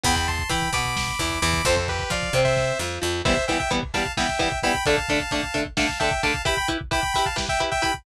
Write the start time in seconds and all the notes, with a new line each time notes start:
0.04 E2 E3 B3 G5 B5, kick, closed hi-hat
0.16 G5 B5, kick
0.28 A5 C6, kick, closed hi-hat
0.39 kick
0.49 E3 E4 G5 B5, kick, closed hi-hat
0.62 kick
0.73 B2 B3 B5 D6, kick, closed hi-hat
0.85 kick
0.97 kick, snare
1.08 kick
1.19 E2 E3, kick, closed hi-hat
1.30 kick
1.42 E2 E3 B5 D6, kick, closed hi-hat
1.54 kick
1.65 F2 F3 C4 A4 C5, kick, closed hi-hat
1.76 A4 C5, kick
1.88 G4 B4, kick, closed hi-hat
1.99 kick
2.10 F3 F4 D5 F5, kick, closed hi-hat
2.23 kick
2.33 C3 C4, kick, closed hi-hat
2.44 C5 E5, kick
2.56 kick, snare
2.79 F2 F3, snare
3.02 F2 F3
3.25 E3 G3 B3 C5 E5, kick, crash
3.37 kick
3.48 E3 G3 B3 E5 G5, kick, closed hi-hat
3.59 E5 G5, kick
3.71 E3 G3 B3, kick, closed hi-hat
3.83 kick
3.94 E3 G3 B3 F5 A5, kick, closed hi-hat
4.06 kick
4.17 E3 G3 B3 E5 G5, kick, snare
4.29 kick
4.39 E3 G3 B3, kick, closed hi-hat
4.52 kick
4.63 E3 G3 B3 G5 B5, kick, closed hi-hat
4.75 kick
4.86 D3 A3 D4 F5 A5, kick, closed hi-hat
4.98 kick
5.09 D3 A3 D4, kick, closed hi-hat
5.20 kick
5.31 D3 A3 D4, kick, closed hi-hat
5.43 kick
5.54 D3 A3 D4, kick, closed hi-hat
5.65 kick
5.77 D3 A3 D4 F5 A5, kick, snare
5.89 kick
5.99 D3 A3 D4 E5 G5, kick, closed hi-hat
6.11 kick
6.23 D3 A3 D4 F5 A5, kick, closed hi-hat
6.34 kick
6.45 E4 G4 B4 G5 B5, kick, closed hi-hat
6.57 G5 B5, kick
6.68 E4 G4 B4, kick, closed hi-hat
6.81 kick
6.91 E4 G4 B4 G5 B5, kick, closed hi-hat
7.03 kick
7.14 E4 G4 B4 G5 B5, kick, closed hi-hat
7.26 F5 A5, kick
7.36 E4 G4 B4, kick, snare
7.49 E5 G5, kick
7.60 E4 G4 B4, kick, closed hi-hat
7.71 E5 G5, kick
7.82 E4 G4 B4 G5 B5, kick, closed hi-hat
7.94 kick